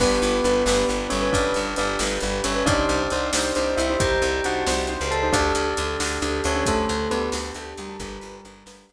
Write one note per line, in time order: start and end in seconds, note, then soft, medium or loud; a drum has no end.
0.00 0.19 G1 medium
0.00 0.97 B3 medium
0.00 0.35 D4 medium
0.00 0.35 G4 medium
0.00 0.35 B4 medium
0.00 2.64 B4 medium
0.00 0.97 B4 loud
0.00 2.64 D5 medium
0.00 2.64 G5 medium
0.00 kick medium
0.00 crash loud
0.22 0.41 G1 medium
0.22 closed hi-hat medium
0.44 0.63 G1 medium
0.44 0.62 D4 medium
0.44 0.62 G4 medium
0.44 0.62 B4 medium
0.44 closed hi-hat medium
0.66 0.85 G1 medium
0.66 0.85 D4 medium
0.66 0.85 G4 medium
0.66 0.85 B4 medium
0.66 snare loud
0.89 1.08 G1 medium
0.89 1.16 D4 medium
0.89 1.16 G4 medium
0.89 1.16 B4 medium
0.89 closed hi-hat medium
1.10 1.31 G1 medium
1.10 1.29 C#4 medium
1.10 1.29 C#5 medium
1.10 closed hi-hat medium
1.22 1.57 D4 medium
1.22 1.57 G4 medium
1.22 1.57 B4 medium
1.32 1.53 G1 medium
1.32 1.73 D4 medium
1.32 1.73 D5 loud
1.32 kick loud
1.32 closed hi-hat loud
1.54 1.75 G1 medium
1.54 closed hi-hat medium
1.76 1.97 G1 medium
1.76 1.95 D4 medium
1.76 1.97 D4 medium
1.76 1.95 G4 medium
1.76 1.95 B4 medium
1.76 1.97 D5 medium
1.76 closed hi-hat medium
1.99 2.19 G1 medium
1.99 2.18 D4 medium
1.99 2.18 G4 medium
1.99 2.18 B4 medium
1.99 snare loud
2.20 2.41 G1 medium
2.20 2.49 D4 medium
2.20 2.49 G4 medium
2.20 2.49 B4 medium
2.20 closed hi-hat medium
2.44 2.64 G1 medium
2.44 2.65 C#4 medium
2.44 2.65 C#5 medium
2.44 closed hi-hat loud
2.56 2.65 D4 medium
2.56 2.65 G4 medium
2.56 2.65 B4 medium
2.66 2.85 C2 medium
2.66 3.72 D4 loud
2.66 3.02 D4 medium
2.66 3.02 D#4 medium
2.66 3.02 G4 medium
2.66 5.30 C5 medium
2.66 3.02 C5 medium
2.66 3.72 D5 loud
2.66 5.30 D5 medium
2.66 5.30 D#5 medium
2.66 5.30 G5 medium
2.66 kick loud
2.66 closed hi-hat loud
2.89 3.08 C2 medium
2.89 closed hi-hat medium
3.10 3.31 C2 medium
3.10 3.30 D4 medium
3.10 3.30 D#4 medium
3.10 3.30 G4 medium
3.10 3.30 C5 medium
3.10 closed hi-hat medium
3.33 3.52 C2 medium
3.33 3.52 D4 medium
3.33 3.52 D#4 medium
3.33 3.52 G4 medium
3.33 3.52 C5 medium
3.33 snare loud
3.55 3.75 C2 medium
3.55 3.82 D4 medium
3.55 3.82 D#4 medium
3.55 3.82 G4 medium
3.55 3.82 C5 medium
3.55 closed hi-hat medium
3.77 3.96 C2 medium
3.77 3.97 E4 medium
3.77 3.97 E5 medium
3.77 closed hi-hat medium
3.90 4.25 D4 medium
3.90 4.25 D#4 medium
3.90 4.25 G4 medium
3.90 4.25 C5 medium
4.00 4.19 C2 medium
4.00 4.43 G4 medium
4.00 4.43 G5 medium
4.00 kick loud
4.00 closed hi-hat loud
4.22 4.41 C2 medium
4.22 closed hi-hat medium
4.44 4.64 C2 medium
4.44 4.62 D4 medium
4.44 4.62 D#4 medium
4.44 4.67 F#4 medium
4.44 4.62 G4 medium
4.44 4.62 C5 medium
4.44 4.67 F#5 medium
4.44 closed hi-hat medium
4.67 4.97 C2 medium
4.67 4.85 D4 medium
4.67 4.85 D#4 medium
4.67 4.85 G4 medium
4.67 4.85 C5 medium
4.67 snare loud
4.87 5.15 D4 medium
4.87 5.15 D#4 medium
4.87 5.15 G4 medium
4.87 5.15 C5 medium
4.87 closed hi-hat medium
5.01 5.31 C#2 medium
5.11 5.29 A4 medium
5.11 5.29 A5 medium
5.11 closed hi-hat medium
5.23 5.32 D4 medium
5.23 5.32 D#4 medium
5.23 5.32 G4 medium
5.23 5.32 C5 medium
5.33 5.52 D2 loud
5.33 6.40 D4 medium
5.33 7.97 D4 medium
5.33 5.69 D4 medium
5.33 7.97 G4 medium
5.33 5.69 G4 medium
5.33 7.97 A4 medium
5.33 5.69 A4 medium
5.33 6.40 D5 loud
5.33 kick loud
5.33 closed hi-hat loud
5.55 5.74 D2 medium
5.55 closed hi-hat medium
5.77 5.97 D2 medium
5.77 5.96 D4 medium
5.77 5.96 G4 medium
5.77 5.96 A4 medium
5.77 closed hi-hat medium
6.00 6.19 D2 medium
6.00 6.18 D4 medium
6.00 6.18 G4 medium
6.00 6.18 A4 medium
6.00 snare loud
6.22 6.41 D2 medium
6.22 6.49 D4 medium
6.22 6.49 G4 medium
6.22 6.49 A4 medium
6.22 closed hi-hat medium
6.44 6.64 D2 medium
6.44 6.66 C#4 medium
6.44 6.66 C#5 medium
6.44 closed hi-hat medium
6.55 6.91 D4 medium
6.55 6.91 G4 medium
6.55 6.91 A4 medium
6.66 6.86 D2 medium
6.66 7.10 A3 medium
6.66 7.10 A4 loud
6.66 kick loud
6.66 closed hi-hat loud
6.89 7.08 D2 medium
6.89 closed hi-hat medium
7.11 7.30 D2 medium
7.11 7.30 B3 medium
7.11 7.29 D4 medium
7.11 7.29 G4 medium
7.11 7.29 A4 medium
7.11 7.30 B4 loud
7.11 closed hi-hat medium
7.32 7.52 D2 medium
7.32 7.52 D4 medium
7.32 7.52 G4 medium
7.32 7.52 A4 medium
7.32 snare loud
7.54 7.74 D2 medium
7.54 7.82 D4 medium
7.54 7.82 G4 medium
7.54 7.82 A4 medium
7.54 closed hi-hat medium
7.77 7.97 D2 medium
7.77 7.98 G3 medium
7.77 7.98 G4 medium
7.77 closed hi-hat medium
7.89 7.98 D4 medium
7.89 7.98 G4 medium
7.89 7.98 A4 medium
8.00 8.18 G1 loud
8.00 8.86 G3 medium
8.00 8.93 D4 medium
8.00 8.36 D4 medium
8.00 8.93 G4 medium
8.00 8.36 G4 medium
8.00 8.86 G4 loud
8.00 8.93 B4 medium
8.00 8.36 B4 medium
8.00 kick loud
8.00 closed hi-hat loud
8.21 8.41 G1 medium
8.21 closed hi-hat medium
8.45 8.64 G1 medium
8.45 8.63 D4 medium
8.45 8.63 G4 medium
8.45 8.63 B4 medium
8.45 closed hi-hat medium
8.66 8.85 G1 medium
8.66 8.84 D4 medium
8.66 8.84 G4 medium
8.66 8.84 B4 medium
8.66 snare loud
8.89 8.93 G1 medium
8.89 8.93 D4 medium
8.89 8.93 G4 medium
8.89 8.93 B4 medium
8.89 closed hi-hat medium